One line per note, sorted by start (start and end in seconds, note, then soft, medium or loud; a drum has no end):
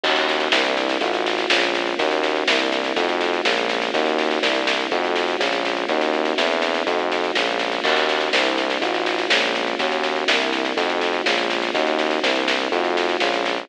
0.03 0.49 D#2 medium
0.03 0.51 A#3 medium
0.03 0.51 C#4 medium
0.03 0.51 D#4 medium
0.03 0.51 F#4 medium
0.03 kick medium
0.03 snare medium
0.03 crash medium
0.16 snare medium
0.28 snare medium
0.40 snare medium
0.52 0.97 C2 loud
0.52 1.00 A#3 medium
0.52 1.00 C4 medium
0.52 1.00 D4 medium
0.52 1.00 E4 medium
0.52 snare loud
0.65 snare medium
0.77 snare medium
0.89 snare medium
1.01 1.46 A1 medium
1.01 1.49 A3 medium
1.01 1.49 D#4 medium
1.01 1.49 F4 medium
1.01 1.49 F#4 medium
1.01 kick medium
1.01 snare medium
1.14 snare medium
1.26 snare medium
1.38 snare medium
1.50 1.95 A#1 medium
1.50 1.98 G#3 medium
1.50 1.98 A#3 medium
1.50 1.98 C#4 medium
1.50 1.98 F4 medium
1.50 snare loud
1.62 snare medium
1.74 snare medium
1.87 snare medium
1.99 2.44 D#2 medium
1.99 2.47 A#3 medium
1.99 2.47 C#4 medium
1.99 2.47 D#4 medium
1.99 2.47 F#4 medium
1.99 kick medium
1.99 snare medium
2.11 snare medium
2.23 snare medium
2.36 snare medium
2.48 2.93 C2 medium
2.48 2.96 A#3 loud
2.48 2.96 C4 medium
2.48 2.96 D4 medium
2.48 2.96 E4 medium
2.48 snare loud
2.59 snare medium
2.72 snare medium
2.84 snare medium
2.96 3.41 F2 loud
2.96 3.45 A3 medium
2.96 3.45 D#4 medium
2.96 3.45 F4 medium
2.96 3.45 F#4 medium
2.96 kick medium
2.96 snare medium
3.09 snare medium
3.21 snare medium
3.33 snare medium
3.45 3.90 A#1 medium
3.45 3.93 G#3 medium
3.45 3.93 A#3 medium
3.45 3.93 C#4 medium
3.45 3.93 F4 medium
3.45 snare loud
3.57 snare medium
3.69 snare medium
3.82 snare medium
3.94 4.39 D#2 loud
3.94 4.42 A#3 medium
3.94 4.42 C#4 medium
3.94 4.42 D#4 medium
3.94 4.42 F#4 medium
3.94 kick loud
3.94 snare medium
4.06 snare medium
4.18 snare medium
4.31 snare medium
4.42 4.88 C2 medium
4.42 4.90 A#3 medium
4.42 4.90 C4 loud
4.42 4.90 D4 medium
4.42 4.90 E4 medium
4.42 snare loud
4.55 snare medium
4.67 snare loud
4.79 snare medium
4.91 5.36 F2 medium
4.91 5.40 A3 medium
4.91 5.40 D#4 medium
4.91 5.40 F4 medium
4.91 5.40 F#4 medium
4.91 kick medium
4.91 snare medium
5.04 snare medium
5.16 snare medium
5.28 snare medium
5.40 5.85 A#1 loud
5.40 5.88 G#3 medium
5.40 5.88 A#3 medium
5.40 5.88 C#4 medium
5.40 5.88 F4 medium
5.40 snare medium
5.53 snare medium
5.65 snare medium
5.77 snare medium
5.89 6.34 D#2 medium
5.89 6.37 A#3 medium
5.89 6.38 C#4 medium
5.89 6.38 D#4 medium
5.89 6.38 F#4 medium
5.89 kick medium
5.89 snare medium
6.01 snare medium
6.13 snare medium
6.25 snare medium
6.38 6.83 E2 loud
6.38 6.85 A#3 medium
6.38 6.85 C4 medium
6.38 6.85 D4 medium
6.38 6.85 E4 medium
6.38 snare medium
6.51 snare medium
6.62 snare medium
6.74 snare medium
6.87 7.31 F2 medium
6.87 7.35 A3 medium
6.87 7.35 D#4 medium
6.87 7.35 F4 medium
6.87 7.35 F#4 medium
6.87 kick medium
6.87 snare medium
6.99 snare medium
7.12 snare medium
7.24 snare medium
7.35 7.80 A#1 loud
7.35 7.83 G#3 medium
7.35 7.83 A#3 medium
7.35 7.83 C#4 medium
7.35 7.83 F4 medium
7.35 snare loud
7.47 snare medium
7.59 snare medium
7.72 snare medium
7.84 8.29 D#2 medium
7.84 8.32 A#3 medium
7.84 8.32 C#4 medium
7.84 8.32 D#4 medium
7.84 8.32 F#4 medium
7.84 kick medium
7.84 snare medium
7.84 crash medium
7.96 snare medium
8.09 snare medium
8.21 snare medium
8.33 8.78 C2 loud
8.33 8.81 A#3 medium
8.33 8.81 C4 medium
8.33 8.81 D4 medium
8.33 8.81 E4 medium
8.33 snare loud
8.45 snare medium
8.58 snare medium
8.70 snare medium
8.81 9.27 A1 medium
8.81 9.29 A3 medium
8.81 9.29 D#4 medium
8.81 9.29 F4 medium
8.81 9.29 F#4 medium
8.81 kick medium
8.81 snare medium
8.94 snare medium
9.06 snare medium
9.18 snare medium
9.30 9.75 A#1 medium
9.30 9.78 G#3 medium
9.30 9.78 A#3 medium
9.30 9.78 C#4 medium
9.30 9.78 F4 medium
9.30 snare loud
9.43 snare medium
9.55 snare medium
9.67 snare medium
9.79 10.24 D#2 medium
9.79 10.27 A#3 medium
9.79 10.27 C#4 medium
9.79 10.27 D#4 medium
9.79 10.27 F#4 medium
9.79 kick medium
9.79 snare medium
9.92 snare medium
10.03 snare medium
10.16 snare medium
10.28 10.73 C2 medium
10.28 10.76 A#3 loud
10.28 10.76 C4 medium
10.28 10.76 D4 medium
10.28 10.76 E4 medium
10.28 snare loud
10.40 snare medium
10.53 snare medium
10.65 snare medium
10.77 11.22 F2 loud
10.77 11.25 A3 medium
10.77 11.25 D#4 medium
10.77 11.25 F4 medium
10.77 11.25 F#4 medium
10.77 kick medium
10.77 snare medium
10.89 snare medium
11.01 snare medium
11.13 snare medium
11.26 11.71 A#1 medium
11.26 11.74 G#3 medium
11.26 11.74 A#3 medium
11.26 11.74 C#4 medium
11.26 11.74 F4 medium
11.26 snare loud
11.38 snare medium
11.50 snare medium
11.62 snare medium
11.74 12.19 D#2 loud
11.74 12.22 A#3 medium
11.74 12.22 C#4 medium
11.74 12.22 D#4 medium
11.74 12.22 F#4 medium
11.74 kick loud
11.74 snare medium
11.87 snare medium
11.99 snare medium
12.11 snare medium
12.23 12.68 C2 medium
12.23 12.71 A#3 medium
12.23 12.71 C4 loud
12.23 12.71 D4 medium
12.23 12.71 E4 medium
12.23 snare loud
12.36 snare medium
12.48 snare loud
12.60 snare medium
12.71 13.17 F2 medium
12.71 13.20 A3 medium
12.71 13.20 D#4 medium
12.71 13.20 F4 medium
12.71 13.20 F#4 medium
12.71 kick medium
12.71 snare medium
12.84 snare medium
12.97 snare medium
13.09 snare medium
13.20 13.66 A#1 loud
13.20 13.69 G#3 medium
13.20 13.69 A#3 medium
13.20 13.69 C#4 medium
13.20 13.69 F4 medium
13.20 snare medium
13.34 snare medium
13.46 snare medium
13.57 snare medium